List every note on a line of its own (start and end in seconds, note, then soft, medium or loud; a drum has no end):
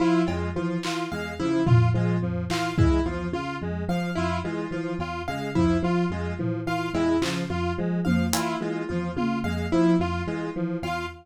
0.00 0.23 F3 medium
0.00 0.22 E4 medium
0.00 0.22 F4 medium
0.27 0.50 F2 medium
0.27 0.50 G#3 medium
0.27 0.49 F4 medium
0.27 cowbell medium
0.55 0.78 E3 medium
0.55 0.77 F3 medium
0.55 0.78 F4 medium
0.83 1.07 E3 medium
0.83 1.06 F4 medium
0.83 clap medium
1.11 1.34 E2 medium
1.11 1.34 G#3 medium
1.11 1.34 F5 medium
1.39 1.62 C#3 medium
1.39 1.61 F3 medium
1.39 1.62 E4 medium
1.66 1.90 F2 medium
1.66 1.89 F4 medium
1.66 floor tom loud
1.94 2.17 F3 medium
1.94 2.17 G#3 medium
1.94 2.17 F4 medium
2.22 2.44 F2 medium
2.22 2.44 F3 medium
2.50 2.72 E3 medium
2.50 2.73 F4 medium
2.50 2.73 F5 medium
2.50 clap medium
2.78 3.00 E3 medium
2.78 3.00 G#3 medium
2.78 3.01 E4 medium
2.78 kick medium
3.06 3.28 E2 medium
3.06 3.28 F3 medium
3.06 3.28 F4 medium
3.33 3.55 C#3 medium
3.33 3.56 F4 medium
3.61 3.84 F2 medium
3.61 3.84 G#3 medium
3.88 4.10 F3 medium
3.88 4.11 F3 medium
3.88 4.11 F5 medium
4.16 4.39 F2 medium
4.16 4.38 E4 medium
4.16 4.39 F4 medium
4.44 4.66 E3 medium
4.44 4.66 G#3 medium
4.44 4.67 F4 medium
4.71 4.93 E3 medium
4.71 4.94 F3 medium
4.71 4.94 F4 medium
4.99 5.21 E2 medium
4.99 5.22 F4 medium
4.99 cowbell medium
5.28 5.50 C#3 medium
5.28 5.50 G#3 medium
5.28 5.50 F5 medium
5.55 5.78 F2 medium
5.55 5.78 F3 medium
5.55 5.78 E4 medium
5.55 kick medium
5.83 6.05 F3 medium
5.83 6.06 F4 medium
6.10 6.32 F2 medium
6.10 6.34 G#3 medium
6.10 6.34 F4 medium
6.39 6.62 E3 medium
6.39 6.61 F3 medium
6.39 floor tom medium
6.67 6.89 E3 medium
6.67 6.89 F4 medium
6.67 6.89 F5 medium
6.94 7.16 E2 medium
6.94 7.16 G#3 medium
6.94 7.17 E4 medium
6.94 cowbell medium
7.21 7.44 C#3 medium
7.21 7.44 F3 medium
7.21 7.44 F4 medium
7.21 clap medium
7.50 7.72 F2 medium
7.50 7.72 F4 medium
7.50 7.73 F4 medium
7.78 8.00 F3 medium
7.78 8.00 G#3 medium
8.05 8.29 F2 medium
8.05 8.28 F3 medium
8.05 8.27 F5 medium
8.05 high tom medium
8.33 8.55 E3 medium
8.33 8.55 E4 medium
8.33 8.56 F4 medium
8.33 closed hi-hat loud
8.60 8.83 E3 medium
8.60 8.83 G#3 medium
8.60 8.84 F4 medium
8.89 9.12 E2 medium
8.89 9.12 F3 medium
8.89 9.11 F4 medium
9.16 9.39 C#3 medium
9.16 9.39 F4 medium
9.16 high tom medium
9.44 9.66 F2 medium
9.44 9.67 G#3 medium
9.44 9.66 F5 medium
9.72 9.95 F3 medium
9.72 9.94 E4 medium
9.99 10.21 F2 medium
9.99 10.22 F4 medium
9.99 10.23 F4 medium
10.27 10.49 E3 medium
10.27 10.49 G#3 medium
10.27 10.50 F4 medium
10.55 10.78 E3 medium
10.55 10.78 F3 medium
10.82 11.05 E2 medium
10.82 11.06 F4 medium
10.82 11.05 F5 medium
10.82 cowbell medium